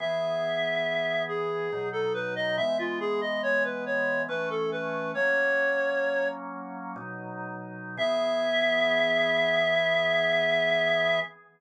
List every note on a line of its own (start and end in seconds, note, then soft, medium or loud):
0.00 1.69 E3 medium
0.00 1.69 B3 medium
0.00 1.69 G#4 medium
0.00 1.23 E5 medium
1.29 1.89 G#4 medium
1.73 2.57 B2 medium
1.73 2.57 F#3 medium
1.73 2.57 D#4 medium
1.93 2.13 A4 medium
2.14 2.34 B4 medium
2.36 2.56 D#5 medium
2.57 4.27 E3 medium
2.57 4.27 G#3 medium
2.57 4.27 B3 medium
2.57 2.77 E5 medium
2.79 2.99 F4 medium
3.00 3.20 G#4 medium
3.21 3.42 D#5 medium
3.43 3.63 C#5 medium
3.64 3.85 B4 medium
3.86 4.22 C#5 medium
4.29 5.13 E3 medium
4.29 5.13 A3 medium
4.29 5.13 C#4 medium
4.29 4.49 B4 medium
4.50 4.70 A4 medium
4.72 5.12 B4 medium
5.14 6.95 F#3 medium
5.14 6.96 A#3 medium
5.14 6.96 C#4 medium
5.14 6.28 C#5 medium
6.96 7.96 B2 medium
6.96 7.96 F#3 medium
6.96 7.96 D#4 medium
7.97 11.19 E3 loud
7.97 11.19 B3 medium
7.97 11.19 G#4 loud
7.97 11.20 E5 loud